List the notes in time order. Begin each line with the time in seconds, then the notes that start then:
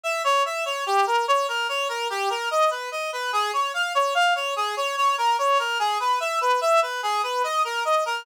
0.04 E5
0.24 C#5
0.45 E5
0.65 C#5
0.86 G4
1.07 A#4
1.28 C#5
1.48 A#4
1.69 C#5
1.89 A#4
2.10 G4
2.30 A#4
2.51 D#5
2.71 B4
2.92 D#5
3.13 B4
3.33 G#4
3.53 C#5
3.74 F5
3.95 C#5
4.15 F5
4.35 C#5
4.56 G#4
4.77 C#5
4.97 C#5
5.18 A#4
5.39 C#5
5.59 A#4
5.79 G#4
6.00 B4
6.20 E5
6.41 B4
6.61 E5
6.82 B4
7.03 G#4
7.23 B4
7.44 D#5
7.65 A#4
7.85 D#5
8.06 A#4